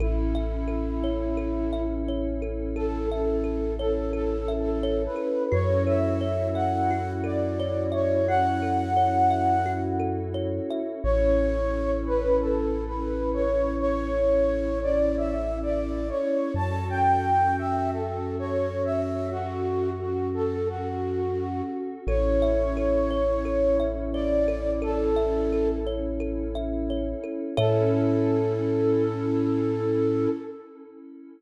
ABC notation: X:1
M:4/4
L:1/8
Q:1/4=87
K:Amix
V:1 name="Flute"
E6 z2 | A A2 A (3A2 A2 B2 | c e2 f2 d2 c | f5 z3 |
c3 B (3A2 B2 c2 | c3 d (3e2 d2 c2 | a g2 e (3A2 c2 e2 | F2 F A F3 z |
c6 d2 | A3 z5 | A8 |]
V:2 name="Kalimba"
A e A c A e c A | A e A c A e c A | F A c e F A c e | F A c e F A c e |
z8 | z8 | z8 | z8 |
A e A c A e c A | A e A c A e c A | [Ace]8 |]
V:3 name="Synth Bass 2" clef=bass
A,,,8- | A,,,8 | F,,8- | F,,8 |
A,,,8- | A,,,8 | F,,8- | F,,8 |
A,,,8- | A,,,8 | A,,8 |]
V:4 name="Pad 5 (bowed)"
[CEA]8- | [CEA]8 | [CEFA]8- | [CEFA]8 |
[CEA]8- | [CEA]8 | [CFA]8- | [CFA]8 |
[CEA]8- | [CEA]8 | [CEA]8 |]